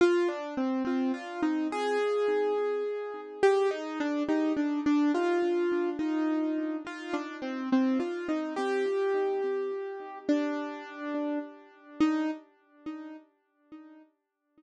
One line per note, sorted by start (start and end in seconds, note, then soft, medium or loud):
0.01 0.28 F4 loud
0.28 0.54 D4 medium
0.57 0.83 C4 medium
0.85 1.12 C4 medium
1.14 1.41 F4 medium
1.43 1.68 D#4 medium
1.72 3.21 G#4 loud
3.43 3.69 G4 loud
3.71 3.98 D#4 loud
4.00 4.23 D4 loud
4.29 4.53 D#4 medium
4.57 4.80 D4 medium
4.86 5.12 D4 loud
5.14 5.90 F4 loud
5.99 6.77 D#4 medium
6.87 7.14 F4 medium
7.13 7.36 D4 medium
7.42 7.69 C4 medium
7.72 7.98 C4 medium
8.00 8.27 F4 medium
8.28 8.53 D#4 medium
8.56 10.18 G4 loud
10.29 11.39 D4 loud
12.00 12.30 D#4 loud